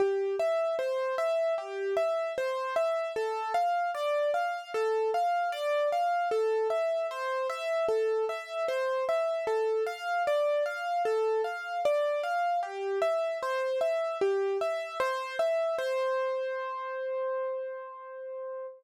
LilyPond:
\new Staff { \time 4/4 \key c \major \tempo 4 = 76 g'8 e''8 c''8 e''8 g'8 e''8 c''8 e''8 | a'8 f''8 d''8 f''8 a'8 f''8 d''8 f''8 | a'8 e''8 c''8 e''8 a'8 e''8 c''8 e''8 | a'8 f''8 d''8 f''8 a'8 f''8 d''8 f''8 |
g'8 e''8 c''8 e''8 g'8 e''8 c''8 e''8 | c''1 | }